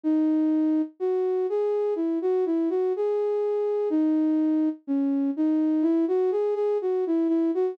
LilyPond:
\new Staff { \time 4/4 \key b \major \tempo 4 = 62 dis'4 fis'8 gis'8 e'16 fis'16 e'16 fis'16 gis'4 | dis'4 cis'8 dis'8 e'16 fis'16 gis'16 gis'16 fis'16 e'16 e'16 fis'16 | }